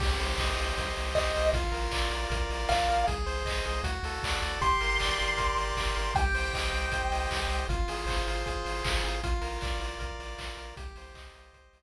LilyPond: <<
  \new Staff \with { instrumentName = "Lead 1 (square)" } { \time 4/4 \key c \minor \tempo 4 = 156 r2. ees''4 | r2. f''4 | r1 | c'''1 |
g''1 | r1 | r1 | r1 | }
  \new Staff \with { instrumentName = "Lead 1 (square)" } { \time 4/4 \key c \minor g'8 c''8 ees''8 g'8 c''8 ees''8 g'8 c''8 | f'8 bes'8 d''8 f'8 bes'8 d''8 f'8 bes'8 | aes'8 c''8 ees''8 aes'8 fis'8 a'8 d''8 fis'8 | g'8 bes'8 d''8 g'8 bes'8 d''8 g'8 bes'8 |
g'8 c''8 ees''8 g'8 c''8 ees''8 g'8 c''8 | f'8 aes'8 c''8 f'8 aes'8 c''8 f'8 aes'8 | f'8 bes'8 d''8 f'8 bes'8 d''8 f'8 bes'8 | g'8 c''8 ees''8 g'8 c''8 ees''8 r4 | }
  \new Staff \with { instrumentName = "Synth Bass 1" } { \clef bass \time 4/4 \key c \minor c,8 c,8 c,8 c,8 c,8 c,8 c,8 c,8 | bes,,8 bes,,8 bes,,8 bes,,8 bes,,8 bes,,8 bes,,8 bes,,8 | c,8 c,8 c,8 c,8 d,8 d,8 d,8 d,8 | g,,8 g,,8 g,,8 g,,8 g,,8 g,,8 g,,8 g,,8 |
c,8 c,8 c,8 c,8 c,8 c,8 c,8 c,8 | aes,,8 aes,,8 aes,,8 aes,,8 aes,,8 aes,,8 aes,,8 aes,,8 | bes,,8 bes,,8 bes,,8 bes,,8 bes,,8 bes,,8 bes,,8 bes,,8 | c,8 c,8 c,8 c,8 c,8 c,8 r4 | }
  \new DrumStaff \with { instrumentName = "Drums" } \drummode { \time 4/4 <cymc bd>8 hho8 <hc bd>8 hho8 <hh bd>8 hho8 <hc bd>8 hho8 | <hh bd>8 hho8 <hc bd>8 hho8 <hh bd>8 hho8 <hc bd>8 hho8 | <hh bd>8 hho8 <hc bd>8 hho8 <hh bd>8 hho8 <hc bd>8 hho8 | <hh bd>8 hho8 <hc bd>8 hho8 <hh bd>8 hho8 <hc bd>8 hho8 |
<hh bd>8 hho8 <hc bd>8 hho8 <hh bd>8 hho8 <hc bd>8 hho8 | <hh bd>8 hho8 <hc bd>8 hho8 <hh bd>8 hho8 <hc bd>8 hho8 | <hh bd>8 hho8 <hc bd>8 hho8 <hh bd>8 hho8 <hc bd>8 hho8 | <hh bd>8 hho8 <hc bd>8 hho8 <hh bd>8 hho8 r4 | }
>>